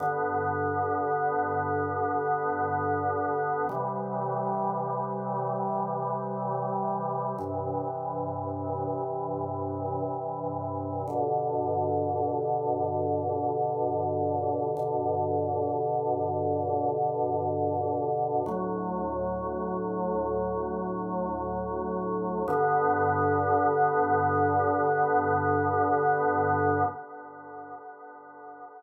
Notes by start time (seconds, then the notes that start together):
0.00 G2 D3 B3
3.69 C3 E3 G3
7.38 G2 C3 E3
11.08 G2 B2 D3
14.77 G2 B2 D3
18.46 D2 A2 F#3
22.48 G2 D3 B3